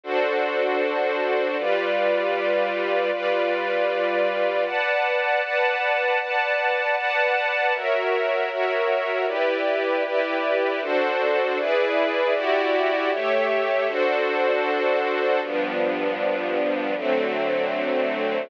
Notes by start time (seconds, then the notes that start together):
0.04 D4 F#4 A4 C5
1.58 G3 F4 B4 D5
3.12 G3 F4 B4 D5
4.65 B4 D5 F#5 A5
5.42 B4 D5 F#5 A5
6.20 B4 D5 F#5 A5
6.96 B4 D5 F#5 A5
7.74 F#4 A#4 C#5 E5
8.50 F#4 A#4 C#5 E5
9.27 E4 G4 B4 D5
10.04 E4 G4 B4 D5
10.82 D4 F#4 A4 C5
11.58 E4 G#4 B4 D5
12.34 E4 F#4 G4 D5
13.11 A3 G4 C#5 E5
13.87 D4 F#4 A4 C5
15.42 G2 F3 B3 D4
16.97 D3 F#3 A3 C4